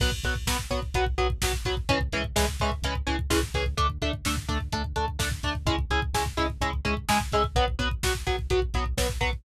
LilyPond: <<
  \new Staff \with { instrumentName = "Overdriven Guitar" } { \time 4/4 \key b \dorian \tempo 4 = 127 <fis b>8 <fis b>8 <fis b>8 <fis b>8 <fis b>8 <fis b>8 <fis b>8 <fis b>8 | <e gis cis'>8 <e gis cis'>8 <e gis cis'>8 <e gis cis'>8 <e gis cis'>8 <e gis cis'>8 <e gis cis'>8 <e gis cis'>8 | <a d'>8 <a d'>8 <a d'>8 <a d'>8 <a d'>8 <a d'>8 <a d'>8 <a d'>8 | <gis cis' e'>8 <gis cis' e'>8 <gis cis' e'>8 <gis cis' e'>8 <gis cis' e'>8 <gis cis' e'>8 <gis cis' e'>8 <gis cis' e'>8 |
<fis b>8 <fis b>8 <fis b>8 <fis b>8 <fis b>8 <fis b>8 <fis b>8 <fis b>8 | }
  \new Staff \with { instrumentName = "Synth Bass 1" } { \clef bass \time 4/4 \key b \dorian b,,8 b,,8 b,,8 b,,8 b,,8 b,,8 b,,8 b,,8 | cis,8 cis,8 cis,8 cis,8 cis,8 cis,8 cis,8 cis,8 | d,8 d,8 d,8 d,8 d,8 d,8 d,8 d,8 | cis,8 cis,8 cis,8 cis,8 cis,8 cis,8 cis,8 cis,8 |
b,,8 b,,8 b,,8 b,,8 b,,8 b,,8 b,,8 b,,8 | }
  \new DrumStaff \with { instrumentName = "Drums" } \drummode { \time 4/4 <cymc bd>16 bd16 <hh bd>16 bd16 <bd sn>16 bd16 <hh bd>16 bd16 <hh bd>16 bd16 <hh bd>16 bd16 <bd sn>16 bd16 <hh bd>16 bd16 | <hh bd>16 bd16 <hh bd>16 bd16 <bd sn>16 bd16 <hh bd>16 bd16 <hh bd>16 bd16 <hh bd>16 bd16 <bd sn>16 bd16 <hh bd>16 bd16 | <hh bd>16 bd16 <hh bd>16 bd16 <bd sn>16 bd16 <hh bd>16 bd16 <hh bd>16 bd16 <hh bd>16 bd16 <bd sn>16 bd16 <hh bd>16 bd16 | <hh bd>16 bd16 <hh bd>16 bd16 <bd sn>16 bd16 <hh bd>16 bd16 <hh bd>16 bd16 <hh bd>16 bd16 <bd sn>16 bd16 <hh bd>16 bd16 |
<hh bd>16 bd16 <hh bd>16 bd16 <bd sn>16 bd16 <hh bd>16 bd16 <hh bd>16 bd16 <hh bd>16 bd16 <bd sn>16 bd16 <hh bd>16 bd16 | }
>>